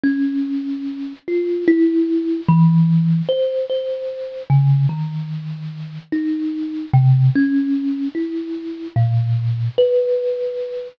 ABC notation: X:1
M:9/8
L:1/8
Q:3/8=49
K:none
V:1 name="Kalimba"
^C3 F E2 E,2 =c | c2 ^C, ^D,3 ^D2 =C, | ^C2 E2 ^A,,2 B3 |]